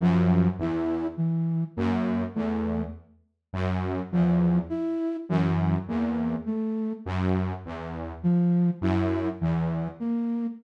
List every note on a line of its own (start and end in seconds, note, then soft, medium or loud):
0.00 0.48 F#2 medium
0.00 0.48 F3 medium
0.59 1.06 E2 medium
0.59 1.07 E4 medium
1.17 1.64 E3 medium
1.76 2.24 F#2 medium
1.76 2.24 A#3 medium
2.35 2.83 E2 medium
2.35 2.82 A3 medium
3.53 4.00 F#2 medium
4.12 4.59 E2 medium
4.12 4.59 F3 medium
4.70 5.17 E4 medium
5.29 5.76 F#2 medium
5.29 5.76 E3 medium
5.88 6.35 E2 medium
5.88 6.36 A#3 medium
6.46 6.93 A3 medium
7.06 7.53 F#2 medium
7.65 8.13 E2 medium
8.23 8.70 F3 medium
8.81 9.28 F#2 medium
8.81 9.29 E4 medium
9.41 9.88 E2 medium
9.41 9.88 E3 medium
10.00 10.47 A#3 medium